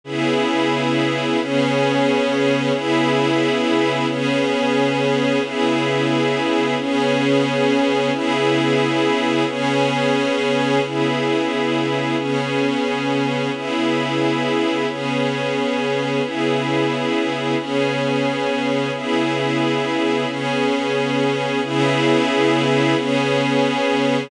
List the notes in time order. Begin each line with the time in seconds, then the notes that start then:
0.04 C#3 B3 E4 G#4
1.39 C#3 B3 C#4 G#4
2.72 C#3 B3 E4 G#4
4.07 C#3 B3 C#4 G#4
5.42 C#3 B3 E4 G#4
6.78 C#3 B3 C#4 G#4
8.11 C#3 B3 E4 G#4
9.46 C#3 B3 C#4 G#4
10.83 C#3 B3 E4 G#4
12.16 C#3 B3 C#4 G#4
13.53 C#3 B3 E4 G#4
14.87 C#3 B3 C#4 G#4
16.22 C#3 B3 E4 G#4
17.57 C#3 B3 C#4 G#4
18.93 C#3 B3 E4 G#4
20.26 C#3 B3 C#4 G#4
21.62 C#3 B3 E4 G#4
22.95 C#3 B3 C#4 G#4